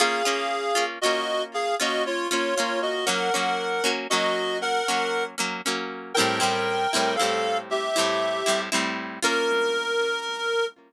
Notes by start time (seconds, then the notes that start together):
0.00 A#3 C#4 F4 G#4 F5
0.25 A#3 C#4 F4
0.75 A#3 C#4 F4
1.01 C#4 F4 F#4 D#5
1.06 A#3
1.54 G#4 F5
1.80 A#3 C#4 F4 F#4 D#5
2.06 F4 C#5
2.31 A#3 C#4 F4 C#5
2.55 C#4 F4 C#5
2.60 A#3
2.82 F#4 D#5
3.06 F#3 A#3 C#4 A#4 F#5
3.34 F#3 A#3 C#4
3.84 F#3 A#3 C#4
4.10 F#3 A#3 C#4 F#4 D#5
4.62 A#4 F#5
4.88 F#3 A#3 C#4
5.38 F#3 A#3 C#4
5.66 F#3 A#3 C#4
6.14 C4 E4 A#4 G5
6.19 A2 G3
6.40 A2 G3 C4 E4
6.93 A2 G3 C4 E4
7.16 E4 A4 F5
7.21 A2 G3 C4
7.71 G4 E5
7.96 A2 G3 C4 E4
8.46 A2 G3 C4 E4
8.72 A2 G3 C4 E4
9.23 A#3 C#4 F4 A#4